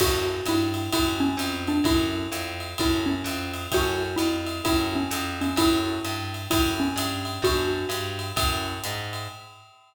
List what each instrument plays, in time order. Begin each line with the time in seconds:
0.00 electric bass (finger) F#2, acoustic grand piano C#4 E4 F#4 A4, xylophone F#4, kick, crash, ride
0.46 electric bass (finger) G2, xylophone E4, hi-hat pedal, ride
0.74 ride
0.92 electric bass (finger) F#2, acoustic grand piano C#4 E4 F#4 A4, xylophone E4, kick, ride
1.20 xylophone C#4
1.37 electric bass (finger) F2, hi-hat pedal, ride
1.67 xylophone D4, ride
1.84 electric bass (finger) F#2, acoustic grand piano C#4 E4 F#4 A4, xylophone E4, kick, ride
2.32 electric bass (finger) F2, hi-hat pedal, ride
2.60 ride
2.78 electric bass (finger) F#2, acoustic grand piano C#4 E4 F#4 A4, xylophone E4, kick, ride
3.06 xylophone C#4
3.24 electric bass (finger) F2, hi-hat pedal, ride
3.54 ride
3.72 electric bass (finger) F#2, acoustic grand piano C#4 E4 F#4 A4, xylophone F#4, kick, ride
4.16 electric bass (finger) F2, xylophone E4, hi-hat pedal, ride
4.47 ride
4.64 electric bass (finger) F#2, acoustic grand piano C#4 E4 F#4 A4, xylophone E4, kick, ride
4.95 xylophone C#4
5.11 electric bass (finger) F2, hi-hat pedal, ride
5.41 xylophone C#4, ride
5.56 electric bass (finger) F#2, acoustic grand piano C#4 E4 F#4 A4, xylophone E4, kick, ride
6.04 electric bass (finger) G2, hi-hat pedal, ride
6.34 ride
6.50 electric bass (finger) F#2, acoustic grand piano C#4 E4 F#4 A4, xylophone E4, kick, ride
6.80 xylophone C#4
6.96 electric bass (finger) G2, hi-hat pedal, ride
7.25 ride
7.42 electric bass (finger) F#2, acoustic grand piano B3 D4 F#4 A4, xylophone F#4, kick, ride
7.89 electric bass (finger) G2, hi-hat pedal, ride
8.19 ride
8.36 electric bass (finger) F#2, acoustic grand piano C#4 E4 F#4 A4, kick, ride
8.84 electric bass (finger) G#2, hi-hat pedal, ride
9.13 ride